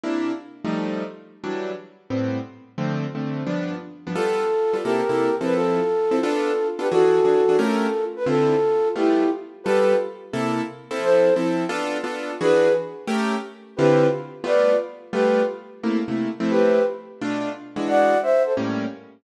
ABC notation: X:1
M:4/4
L:1/8
Q:"Swing" 1/4=175
K:C
V:1 name="Flute"
z8 | z8 | z8 | [FA]4 [G_B]3 =B |
[FA]4 [FA]3 [GB] | [^FA]4 [=FA]3 B | [FA]4 [EG]2 z2 | [GB]2 z6 |
[Ac]2 z6 | [^GB]2 z6 | [GB]2 z2 [Bd]2 z2 | [GB]2 z6 |
[GB]2 z6 | [d^f]2 [ce] [Ac] z4 |]
V:2 name="Acoustic Grand Piano"
[C,_B,DE]3 [F,G,A,_E]5 | [E,^F,G,D]4 [A,,G,B,C]4 | [D,F,A,C]2 [D,F,A,C]2 [G,,F,B,D]3 [G,,F,B,D] | [G,B,FA]3 [G,B,FA] [C,_B,EA] [C,B,EA]2 [F,CEA]- |
[F,CEA]3 [F,CEA] [B,DFA]3 [B,DFA] | [E,D^F^G]2 [E,DFG] [E,DFG] [A,^C=G_B]4 | [D,CEF]4 [G,A,B,F]4 | [G,B,FA]4 [C,_B,EA]3 [F,CEA]- |
[F,CEA]2 [F,CEA]2 [B,DFA]2 [B,DFA]2 | [E,D^F^G]4 [A,^C=G_B]4 | [D,CEF]4 [G,A,B,F]4 | [G,A,B,F]4 [C,A,_B,E] [C,A,B,E]2 [F,A,CE]- |
[F,A,CE]4 [B,,A,DF]3 [E,^G,D^F]- | [E,^G,D^F]4 [A,,=G,_B,^C]4 |]